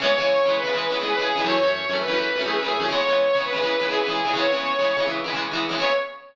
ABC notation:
X:1
M:4/4
L:1/16
Q:1/4=166
K:C#dor
V:1 name="Lead 2 (sawtooth)"
c6 B5 G B G3 | c6 B5 G B G3 | c6 B5 G B G3 | c8 z8 |
c4 z12 |]
V:2 name="Acoustic Guitar (steel)"
[C,E,G,B,]2 [C,E,G,B,]3 [C,E,G,B,]2 [C,E,G,B,] [C,E,G,B,]2 [C,E,G,B,] [C,E,G,B,]2 [C,E,G,B,]2 [C,E,G,B,] | [F,,E,=A,C]2 [F,,E,A,C]3 [F,,E,A,C]2 [F,,E,A,C] [F,,E,A,C]2 [F,,E,A,C] [F,,E,A,C]2 [F,,E,A,C]2 [F,,E,A,C] | [C,E,G,B,]2 [C,E,G,B,]3 [C,E,G,B,]2 [C,E,G,B,] [C,E,G,B,]2 [C,E,G,B,] [C,E,G,B,]2 [C,E,G,B,]2 [C,E,G,B,] | [C,E,G,B,]2 [C,E,G,B,]3 [C,E,G,B,]2 [C,E,G,B,] [C,E,G,B,]2 [C,E,G,B,] [C,E,G,B,]2 [C,E,G,B,]2 [C,E,G,B,] |
[C,E,G,B,]4 z12 |]